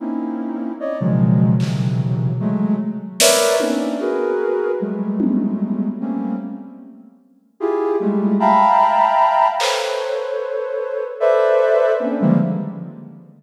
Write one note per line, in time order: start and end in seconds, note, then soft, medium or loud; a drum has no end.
0.00 0.72 A#3 medium
0.00 0.72 C4 medium
0.00 0.72 C#4 medium
0.00 0.72 D#4 medium
0.00 0.72 E4 medium
0.80 0.98 C#5 medium
0.80 0.98 D5 medium
0.80 0.98 D#5 medium
1.00 1.54 B2 medium
1.00 1.54 C#3 medium
1.00 1.54 D#3 medium
1.00 1.54 F3 medium
1.00 1.54 F#3 medium
1.00 1.54 G#3 medium
1.60 2.32 B2 medium
1.60 2.32 C3 medium
1.60 2.32 C#3 medium
1.60 2.32 D#3 medium
1.60 2.32 E3 medium
1.60 2.32 F#3 medium
1.60 clap medium
2.40 2.76 F#3 loud
2.40 2.76 G#3 loud
2.40 2.76 A3 loud
3.20 3.56 A#4 medium
3.20 3.56 B4 medium
3.20 3.56 C#5 medium
3.20 3.56 D5 medium
3.20 3.56 E5 medium
3.20 snare loud
3.60 3.96 A#3 medium
3.60 3.96 C4 medium
3.60 3.96 C#4 medium
3.60 3.96 D4 medium
3.60 3.96 D#4 medium
3.60 high tom medium
4.00 4.72 F#4 medium
4.00 4.72 G#4 medium
4.00 4.72 A#4 medium
4.00 4.72 B4 medium
4.80 5.88 F#3 medium
4.80 5.88 G3 medium
4.80 5.88 G#3 medium
4.80 5.88 A3 medium
5.20 high tom medium
6.00 6.36 G3 medium
6.00 6.36 A3 medium
6.00 6.36 A#3 medium
6.00 6.36 C4 medium
6.00 6.36 C#4 medium
7.60 7.96 E4 medium
7.60 7.96 F4 medium
7.60 7.96 G4 medium
7.60 7.96 G#4 medium
8.00 8.36 G3 loud
8.00 8.36 G#3 loud
8.00 8.36 A3 loud
8.40 9.48 E5 medium
8.40 9.48 F5 medium
8.40 9.48 G5 medium
8.40 9.48 A5 medium
8.40 9.48 A#5 medium
8.40 9.48 B5 medium
9.60 11.04 A4 soft
9.60 11.04 B4 soft
9.60 11.04 C5 soft
9.60 11.04 C#5 soft
9.60 clap medium
11.20 11.92 A4 medium
11.20 11.92 B4 medium
11.20 11.92 C5 medium
11.20 11.92 D5 medium
11.20 11.92 E5 medium
12.00 12.18 A#3 medium
12.00 12.18 C4 medium
12.00 12.18 C#4 medium
12.00 12.18 D4 medium
12.20 12.38 D3 loud
12.20 12.38 D#3 loud
12.20 12.38 F3 loud
12.20 12.38 G3 loud
12.20 12.38 G#3 loud
12.20 12.38 A#3 loud